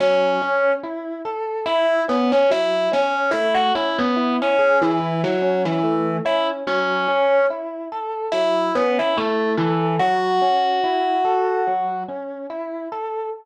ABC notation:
X:1
M:4/4
L:1/16
Q:"Swing 16ths" 1/4=72
K:F#m
V:1 name="Kalimba"
[Cc]4 z4 [Ee]2 [B,B] [Cc] [Ee]2 [Cc]2 | [Ee] [Ff] [Ee] [B,B]2 [Cc]2 [E,E]2 [F,F]2 [E,E]3 [Ee] z | [Cc]4 z4 [Ee]2 [B,B] [Ee] [A,A]2 [E,E]2 | [Ff]12 z4 |]
V:2 name="Electric Piano 1"
F,2 C2 E2 A2 E2 C2 F,2 C2 | A,2 C2 E2 G2 E2 C2 A,2 C2 | F,2 C2 E2 A2 F,2 C2 E2 A2 | F,2 C2 E2 A2 F,2 C2 E2 A2 |]